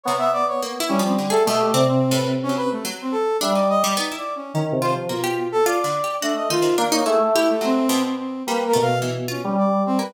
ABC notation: X:1
M:3/4
L:1/16
Q:1/4=107
K:none
V:1 name="Brass Section"
_d e =d _d z2 _D C z A e G | d C2 B z _D B A, z C A2 | e d _e d (3_E2 d2 _D2 z2 c z | F3 A d4 D _e F2 |
z _d _A =A, E A, C3 C C2 | (3B2 _B2 f2 z2 _D D =d2 C =B |]
V:2 name="Electric Piano 2"
B,6 G,3 A, A,2 | C,8 z4 | G,3 z5 (3_E,2 C,2 F,2 | B,,4 z4 A,2 _E,2 |
_B,2 A,6 z4 | _B,2 =B,,5 G,5 |]
V:3 name="Harpsichord"
C,4 (3_B,2 E2 F,2 D, _A =B,,2 | (3C4 A,,4 _G,4 G,4 | D _E2 G, B, =E3 _D2 F2 | _B, G3 (3F2 D,2 G2 _G2 _E C, |
D _E =E2 G2 _G,2 B,,4 | G,2 A,2 E,2 F z4 _B, |]